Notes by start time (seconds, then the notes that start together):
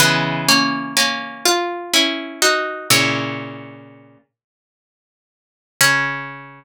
0.00 C#3 E3 G#3 B3 B4
0.48 A#3 C#4
0.97 A#3 C#4
1.45 F4
1.94 C#4 E4
2.42 D#4 F#4
2.90 A#2 C#3 C#4 E4 C#5
5.81 C#3 C#4 C#5